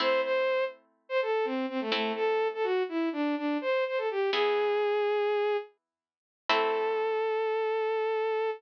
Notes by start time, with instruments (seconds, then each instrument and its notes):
0.00 harpsichord A3 C4 E4, violin C5
0.24 violin C5
1.09 violin C5
1.22 violin A4
1.45 violin C4
1.69 violin C4
1.80 violin A3
1.92 harpsichord A3 C4 E4, violin A3
2.15 violin A4
2.54 violin A4
2.64 violin F#4
2.89 violin E4
3.12 violin D4
3.37 violin D4
3.61 violin C5
3.87 violin C5
3.98 violin A4
4.11 violin G4
4.33 harpsichord E3 B3 G#4, violin G#4
6.49 harpsichord A3 C4 E4, violin A4